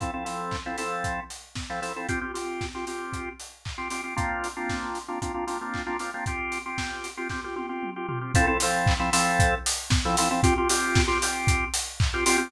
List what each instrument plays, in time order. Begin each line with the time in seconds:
0.00 drawbar organ F3 C4 E4 A4, kick, closed hi-hat
0.14 drawbar organ F3 C4 E4 A4
0.25 drawbar organ F3 C4 E4 A4, open hi-hat
0.51 kick, clap
0.66 drawbar organ F3 C4 E4 A4
0.78 drawbar organ F3 C4 E4 A4, open hi-hat
1.04 kick, closed hi-hat
1.30 open hi-hat
1.55 kick, snare
1.70 drawbar organ F3 C4 E4 A4
1.82 drawbar organ F3 C4 E4 A4, open hi-hat
1.96 drawbar organ F3 C4 E4 A4
2.09 drawbar organ C4 F4 G4, kick, closed hi-hat
2.21 drawbar organ C4 F4 G4
2.34 drawbar organ C4 F4 G4, open hi-hat
2.61 kick, snare
2.75 drawbar organ C4 F4 G4
2.87 drawbar organ C4 F4 G4, open hi-hat
3.13 kick, closed hi-hat
3.40 open hi-hat
3.65 kick, clap
3.78 drawbar organ C4 F4 G4
3.90 drawbar organ C4 F4 G4, open hi-hat
4.04 drawbar organ C4 F4 G4
4.16 drawbar organ A#3 C4 D4 F4, kick, closed hi-hat
4.44 open hi-hat
4.57 drawbar organ A#3 C4 D4 F4
4.69 kick, snare
4.95 open hi-hat
5.08 drawbar organ A#3 C4 D4 F4
5.22 drawbar organ A#3 C4 D4 F4, kick, closed hi-hat
5.34 drawbar organ A#3 C4 D4 F4
5.47 drawbar organ A#3 C4 D4 F4, open hi-hat
5.61 drawbar organ A#3 C4 D4 F4
5.74 kick, clap
5.86 drawbar organ A#3 C4 D4 F4
5.99 drawbar organ A#3 C4 D4 F4, open hi-hat
6.14 drawbar organ A#3 C4 D4 F4
6.26 drawbar organ C4 F4 G4, kick, closed hi-hat
6.52 open hi-hat
6.66 drawbar organ C4 F4 G4
6.78 kick, snare
7.04 open hi-hat
7.17 drawbar organ C4 F4 G4
7.29 drawbar organ C4 F4 G4, kick, snare
7.44 drawbar organ C4 F4 G4
7.56 drawbar organ C4 F4 G4, high tom
7.69 drawbar organ C4 F4 G4
7.83 mid tom
7.96 drawbar organ C4 F4 G4
8.08 drawbar organ C4 F4 G4, floor tom
8.21 drawbar organ C4 F4 G4
8.34 drawbar organ F3 C4 E4 A4, kick, closed hi-hat
8.47 drawbar organ F3 C4 E4 A4
8.60 drawbar organ F3 C4 E4 A4, open hi-hat
8.86 kick, clap
8.99 drawbar organ F3 C4 E4 A4
9.13 drawbar organ F3 C4 E4 A4, open hi-hat
9.39 kick, closed hi-hat
9.66 open hi-hat
9.90 kick, snare
10.05 drawbar organ F3 C4 E4 A4
10.17 drawbar organ F3 C4 E4 A4, open hi-hat
10.31 drawbar organ F3 C4 E4 A4
10.43 drawbar organ C4 F4 G4, kick, closed hi-hat
10.58 drawbar organ C4 F4 G4
10.69 drawbar organ C4 F4 G4, open hi-hat
10.95 kick, snare
11.07 drawbar organ C4 F4 G4
11.22 drawbar organ C4 F4 G4, open hi-hat
11.47 kick, closed hi-hat
11.74 open hi-hat
12.00 kick, clap
12.14 drawbar organ C4 F4 G4
12.26 drawbar organ C4 F4 G4, open hi-hat
12.38 drawbar organ C4 F4 G4